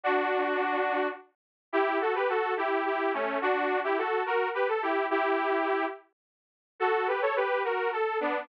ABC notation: X:1
M:6/8
L:1/16
Q:3/8=71
K:F#m
V:1 name="Lead 2 (sawtooth)"
[DF]8 z4 | [K:Bm] [EG]2 [FA] [GB] [FA]2 [EG]2 [EG]2 [A,C]2 | [DF]3 [EG] [FA]2 [F^A]2 [GB] =A [EG]2 | [EG]6 z6 |
[FA]2 [GB] [Ac] [GB]2 [F^A]2 =A2 [B,D]2 |]